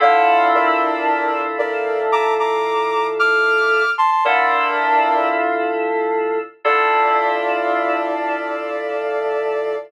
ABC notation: X:1
M:4/4
L:1/16
Q:1/4=113
K:Dm
V:1 name="Ocarina"
[df]4 [Bd]8 [Bd]4 | [bd']2 [bd']6 [d'f']6 [ac'] [ac'] | "^rit." [Bd]8 z8 | d16 |]
V:2 name="Electric Piano 2"
[D,EFA]16- | [D,EFA]16 | "^rit." [D,EFA]16 | [D,EFA]16 |]